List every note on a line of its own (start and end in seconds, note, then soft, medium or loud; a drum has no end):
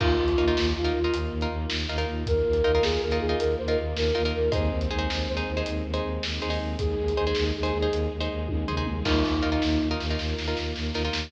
0.00 0.16 D#2 medium
0.00 2.23 A#3 medium
0.00 2.23 D#4 medium
0.00 0.31 D#4 medium
0.00 0.67 F4 medium
0.00 2.23 F4 medium
0.00 0.31 F4 medium
0.00 0.31 A#4 medium
0.00 kick loud
0.00 crash loud
0.18 0.34 D#2 medium
0.28 closed hi-hat medium
0.37 0.54 D#2 medium
0.37 0.46 D#4 medium
0.37 0.46 F4 medium
0.37 0.46 A#4 medium
0.48 0.78 D#4 medium
0.48 0.78 F4 medium
0.48 0.78 A#4 medium
0.57 0.73 D#2 medium
0.57 snare loud
0.76 0.92 D#2 medium
0.76 1.11 F4 medium
0.84 1.00 D#4 medium
0.84 1.00 F4 medium
0.84 1.00 A#4 medium
0.84 closed hi-hat medium
0.93 1.09 D#2 medium
1.04 1.34 D#4 medium
1.04 1.34 F4 medium
1.04 1.34 A#4 medium
1.13 1.29 D#2 medium
1.13 closed hi-hat loud
1.31 1.47 D#2 medium
1.41 1.72 D#4 medium
1.41 1.72 F4 medium
1.41 1.72 A#4 medium
1.41 closed hi-hat medium
1.50 1.66 D#2 medium
1.70 1.86 D#2 medium
1.70 snare loud
1.89 2.05 D#2 medium
1.89 1.97 D#4 medium
1.89 1.97 F4 medium
1.89 1.97 A#4 medium
1.98 2.28 D#4 medium
1.98 2.28 F4 medium
1.98 2.28 A#4 medium
1.98 closed hi-hat medium
2.07 2.24 D#2 medium
2.26 2.42 D#2 medium
2.26 4.52 A#3 medium
2.26 4.52 F4 medium
2.26 2.82 A#4 medium
2.26 4.52 A#4 medium
2.26 kick loud
2.26 closed hi-hat loud
2.46 2.62 D#2 medium
2.53 closed hi-hat medium
2.64 2.80 D#2 medium
2.64 2.72 D#4 medium
2.64 2.72 F4 medium
2.64 2.72 A#4 medium
2.75 3.05 D#4 medium
2.75 3.05 F4 medium
2.75 3.05 A#4 medium
2.81 2.97 D#2 medium
2.81 3.01 G#4 medium
2.81 snare loud
3.01 3.19 D#2 medium
3.01 3.17 A#4 medium
3.11 3.27 D#4 medium
3.11 3.27 F4 medium
3.11 3.27 A#4 medium
3.11 closed hi-hat medium
3.19 3.35 D#2 medium
3.19 3.36 G#4 medium
3.29 3.59 D#4 medium
3.29 3.59 F4 medium
3.29 3.59 A#4 medium
3.39 3.55 D#2 medium
3.39 3.55 A#4 medium
3.39 closed hi-hat loud
3.58 3.76 D#2 medium
3.58 3.67 C5 medium
3.68 3.98 D#4 medium
3.68 3.98 F4 medium
3.68 3.98 A#4 medium
3.68 3.78 A#4 medium
3.68 closed hi-hat medium
3.78 3.94 D#2 medium
3.96 4.12 D#2 medium
3.96 4.24 A#4 medium
3.96 snare loud
4.15 4.32 D#2 medium
4.15 4.22 D#4 medium
4.15 4.22 F4 medium
4.15 4.22 A#4 medium
4.25 4.48 D#4 medium
4.25 4.48 F4 medium
4.25 4.48 A#4 medium
4.25 closed hi-hat medium
4.33 4.49 D#2 medium
4.33 4.50 A#4 medium
4.51 4.69 D#2 medium
4.51 6.76 G#3 medium
4.51 6.76 C4 medium
4.51 6.76 D#4 medium
4.51 4.82 D#4 medium
4.51 4.82 G#4 medium
4.51 4.82 C5 medium
4.51 5.27 C5 medium
4.51 kick loud
4.51 closed hi-hat loud
4.72 4.88 D#2 medium
4.81 closed hi-hat medium
4.90 5.07 D#2 medium
4.90 4.98 D#4 medium
4.90 4.98 G#4 medium
4.90 4.98 C5 medium
4.99 5.29 D#4 medium
4.99 5.29 G#4 medium
4.99 5.29 C5 medium
5.10 5.26 D#2 medium
5.10 snare loud
5.27 5.43 D#2 medium
5.27 5.61 C5 medium
5.37 5.52 D#4 medium
5.37 5.52 G#4 medium
5.37 5.52 C5 medium
5.37 closed hi-hat medium
5.47 5.63 D#2 medium
5.57 5.87 D#4 medium
5.57 5.87 G#4 medium
5.57 5.87 C5 medium
5.66 5.83 D#2 medium
5.66 closed hi-hat loud
5.84 6.00 D#2 medium
5.94 6.24 D#4 medium
5.94 6.24 G#4 medium
5.94 6.24 C5 medium
5.94 closed hi-hat medium
6.03 6.19 D#2 medium
6.23 6.39 D#2 medium
6.23 snare loud
6.42 6.59 D#2 medium
6.42 6.49 D#4 medium
6.42 6.49 G#4 medium
6.42 6.49 C5 medium
6.50 6.80 D#4 medium
6.50 6.80 G#4 medium
6.50 6.80 C5 medium
6.50 open hi-hat medium
6.60 6.76 D#2 medium
6.79 6.95 D#2 medium
6.79 9.04 G#3 medium
6.79 9.03 D#4 medium
6.79 7.44 G#4 medium
6.79 9.04 G#4 medium
6.79 kick loud
6.79 closed hi-hat loud
6.97 7.13 D#2 medium
7.08 closed hi-hat medium
7.17 7.33 D#2 medium
7.17 7.25 D#4 medium
7.17 7.25 G#4 medium
7.17 7.25 C5 medium
7.27 7.57 D#4 medium
7.27 7.57 G#4 medium
7.27 7.57 C5 medium
7.35 7.52 D#2 medium
7.35 snare loud
7.56 7.72 D#2 medium
7.56 7.90 G#4 medium
7.63 7.78 D#4 medium
7.63 7.78 G#4 medium
7.63 7.78 C5 medium
7.63 closed hi-hat medium
7.72 7.88 D#2 medium
7.82 8.13 D#4 medium
7.82 8.13 G#4 medium
7.82 8.13 C5 medium
7.92 8.08 D#2 medium
7.92 closed hi-hat loud
8.12 8.28 D#2 medium
8.20 8.51 D#4 medium
8.20 8.51 G#4 medium
8.20 8.51 C5 medium
8.20 closed hi-hat medium
8.31 8.47 D#2 medium
8.49 8.65 D#2 medium
8.49 kick medium
8.49 high tom medium
8.68 8.85 D#2 medium
8.68 8.76 D#4 medium
8.68 8.76 G#4 medium
8.68 8.76 C5 medium
8.68 floor tom medium
8.77 9.00 D#4 medium
8.77 9.00 G#4 medium
8.77 9.00 C5 medium
8.86 9.03 D#2 medium
8.86 mid tom loud
9.04 9.23 D#2 medium
9.04 10.16 A#3 medium
9.04 10.16 D#4 medium
9.04 9.88 D#4 medium
9.04 9.36 D#4 medium
9.04 10.16 F4 medium
9.04 9.36 F4 medium
9.04 9.36 A#4 medium
9.04 kick medium
9.04 snare medium
9.04 crash loud
9.25 9.41 D#2 medium
9.25 snare medium
9.42 9.59 D#2 medium
9.42 9.50 D#4 medium
9.42 9.50 F4 medium
9.42 9.50 A#4 medium
9.52 9.82 D#4 medium
9.52 9.82 F4 medium
9.52 9.82 A#4 medium
9.62 9.78 D#2 medium
9.62 snare loud
9.81 9.97 D#2 medium
9.91 10.06 D#4 medium
9.91 10.06 F4 medium
9.91 10.06 A#4 medium
10.00 10.17 D#2 medium
10.00 snare medium
10.10 10.41 D#4 medium
10.10 10.41 F4 medium
10.10 10.41 A#4 medium
10.18 10.34 D#2 medium
10.18 11.30 A#3 medium
10.18 11.30 F4 medium
10.18 11.30 A#4 medium
10.18 snare medium
10.38 10.54 D#2 medium
10.38 snare medium
10.48 10.78 D#4 medium
10.48 10.78 F4 medium
10.48 10.78 A#4 medium
10.57 10.73 D#2 medium
10.57 snare medium
10.75 10.91 D#2 medium
10.75 snare medium
10.94 11.10 D#2 medium
10.94 11.03 D#4 medium
10.94 11.03 F4 medium
10.94 11.03 A#4 medium
10.94 snare medium
11.05 11.27 D#4 medium
11.05 11.27 F4 medium
11.05 11.27 A#4 medium
11.12 11.28 D#2 medium
11.12 snare loud